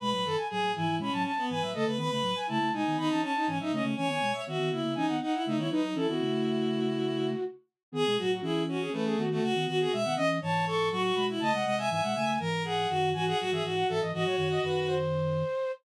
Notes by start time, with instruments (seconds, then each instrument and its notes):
0.00 flute B2 G#3 B5, violin B4
0.11 flute A2 F#3 B5
0.25 flute F#2 D#3, violin A4
0.36 flute G#5
0.49 flute A2 F#3 G#5, violin G#4
0.61 flute A2 F#3
0.74 flute G#2 E3 G#5, violin E4
0.88 flute G#2 E3
0.97 flute B2 G#3 B5, violin C#4
1.12 flute A2 F#3 A5
1.23 flute A5
1.37 violin B3
1.49 flute G#2 E3 G#5, violin B4
1.62 flute A2 F#3 E5
1.73 flute C#3 A3 D#5, violin A4
1.85 flute C#3 A3, violin B4
1.97 flute D#3 B3 B5, violin B4
2.11 flute C#3 A3 B5
2.21 flute A2 F#3
2.35 flute G#5
2.47 flute C#3 A3 A5, violin E4
2.59 flute C#3 A3
2.72 flute B2 G#3 G#5, violin D#4
2.85 flute D#3 B3
2.97 flute D#3 B3 B5, violin D#4
3.09 flute E3 C#4 A5
3.21 violin C#4, flute A5
3.35 violin D#4
3.46 flute G#2 E3 G#5, violin C#4
3.59 flute A2 F#3 E5, violin D#4
3.71 flute C#3 A3 D#5, violin C#4
3.83 flute C#3 A3
3.96 flute E3 C#4 G#5, violin C#5
4.07 flute D#3 B3 G#5
4.21 flute B2 G#3
4.33 flute E5
4.46 flute D#3 B3 E5, violin F#4
4.58 flute D#3 B3
4.71 flute C#3 A#3 E5, violin E4
4.84 flute C#3 A#3
4.94 flute E3 C#4 G#5, violin D#4
5.07 flute D#3 B3 F#5
5.21 violin D#4, flute F#5
5.33 violin E4
5.44 flute C#3 A3 E5, violin D#4
5.56 flute D#3 B3 C#5, violin E4
5.70 flute F#3 D#4 B4, violin D#4
5.82 flute F#3 D#4
5.95 flute E3 C#4 A4, violin E4
6.07 flute D#3 B3 F#4
6.20 flute C#3 A3
7.92 flute D#3 B3 G#4, violin G#4
8.05 flute B2 G#3 G#4
8.17 flute A2 F#3 F#4, violin F#4
8.30 flute F#4
8.41 flute E3 C#4 G#4, violin E4
8.68 violin C#4, flute F#4
8.81 flute G#4
8.92 flute E3 C#4 B4, violin A3
9.05 flute G#4
9.17 flute D#3 B3 F#4
9.29 violin A3, flute F#4
9.41 flute C#3 A3 F#4, violin F#4
9.53 flute D#3 B3 F#4
9.66 flute D#3 B3 F#4, violin F#4
9.80 flute F#4, violin G#4
9.92 flute B2 G#3 E5, violin E5
10.04 flute D#3 B3 F#5
10.16 flute E3 C#4 D#5, violin D#5
10.41 flute G#2 E3 A5, violin C#5
10.66 violin A4, flute C#6
10.91 flute A2 F#3 C#6, violin F#4
11.03 flute C#6
11.15 flute B2 G#3 B5
11.29 violin E4
11.39 flute C#3 A3 A5, violin D#5
11.52 flute C3 G#3 F#5
11.64 flute C3 G#3, violin D#5
11.77 violin E5, flute G#5
11.89 flute G#2 E3 G#5, violin E5
12.02 flute B2 G#3 F#5
12.15 flute C#3 A3 G#5
12.39 flute G#2 E3, violin A#4
12.64 violin G#4, flute F#5
12.89 flute F#2 D#3, violin F#4
13.12 flute G#2 E3 G#5, violin F#4
13.26 violin G#4, flute F#5
13.39 flute A2 F#3 F#5, violin F#4
13.51 flute G#2 E3 E5, violin G#4
13.63 flute G#2 E3, violin F#4
13.75 flute F#5
13.88 flute G#2 E3 E5, violin A4
14.00 flute G#2 E3 D#5
14.13 flute G#2 E3 D#5, violin F#4
14.24 flute A2 F#3 C#5
14.36 flute F#2 D#3 C#5
14.51 flute D#5
14.62 flute F#2 D#3 B4
14.87 flute C5